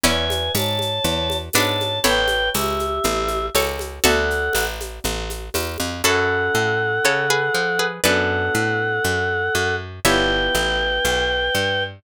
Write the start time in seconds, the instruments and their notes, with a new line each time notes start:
0.03 electric bass (finger) E2, pizzicato strings C#4 E4, choir aahs B4 G#5, orchestral harp D5 E5 G#5 B5, low conga, shaker
0.30 high conga, shaker
0.55 electric bass (finger) G#2, choir aahs C#5 A5, tambourine, high conga, shaker
0.79 high conga, shaker
1.04 electric bass (finger) E2, low conga, shaker
1.30 high conga, shaker
1.53 electric bass (finger) G#2, pizzicato strings B3 D4, choir aahs C#5 A5, tambourine, high conga, shaker
1.81 high conga, shaker
2.04 electric bass (finger) A1, pizzicato strings A4 C#5, choir aahs B4 G5, orchestral harp C#5 G5 A5 B5, low conga, shaker
2.28 high conga, shaker
2.54 electric bass (finger) C#2, choir aahs G4 E5, tambourine, high conga, shaker
2.79 high conga, shaker
3.04 electric bass (finger) A1, low conga, shaker
3.28 high conga, shaker
3.54 electric bass (finger) C#2, pizzicato strings A4 C#5, tambourine, high conga, shaker
3.79 high conga, shaker
4.04 electric bass (finger) D2, pizzicato strings F#4 A4, choir aahs A4 F#5, orchestral harp D5 E5 F#5 A5, low conga, shaker
4.30 shaker
4.53 electric bass (finger) A1, tambourine, high conga, shaker
4.81 high conga, shaker
5.04 electric bass (finger) A1, low conga, shaker
5.30 high conga, shaker
5.54 electric bass (finger) E2, tambourine, high conga, shaker
5.78 electric bass (finger) F2, high conga, shaker
6.04 electric bass (finger) F#2, orchestral harp C#4 E4 F#4 A4, pizzicato strings F#4 A4, choir aahs A4 F#5
6.55 electric bass (finger) A2
7.05 electric bass (finger) C#3, pizzicato strings A4 C#5
7.30 pizzicato strings G#4 B4
7.54 electric bass (finger) F3
7.79 pizzicato strings G#4 B4
8.04 electric bass (finger) F#2, orchestral harp B3 D4 F#4 A4, choir aahs A4 F#5, pizzicato strings B4 D5
8.55 electric bass (finger) A2
9.04 electric bass (finger) F#2
9.55 electric bass (finger) F#2
10.05 electric bass (finger) G1, orchestral harp B3 E4 F4 G4, choir aahs B4 G5, pizzicato strings C#5 E5
10.55 electric bass (finger) A1
11.05 electric bass (finger) B1
11.55 electric bass (finger) G2